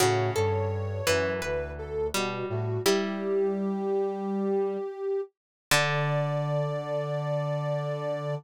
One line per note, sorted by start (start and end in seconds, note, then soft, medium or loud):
0.00 0.30 A2 medium
0.00 0.99 C#3 medium
0.00 0.31 F#4 medium
0.00 1.32 C#5 medium
0.36 1.02 G2 medium
0.36 1.02 A4 medium
1.07 1.40 F#2 medium
1.07 2.02 E3 medium
1.07 1.40 B4 medium
1.42 2.09 D2 medium
1.42 2.67 B4 medium
1.42 1.72 B4 medium
1.79 2.07 A4 medium
2.14 2.44 B2 medium
2.14 2.83 G3 medium
2.14 2.46 F#4 medium
2.49 2.78 A2 medium
2.49 2.82 F#4 medium
2.86 4.89 G3 medium
2.86 4.77 G3 loud
2.86 4.06 E4 medium
2.86 4.06 G4 medium
2.86 5.21 G4 medium
5.71 8.35 D3 loud
5.71 8.35 D4 loud
5.71 8.35 D5 loud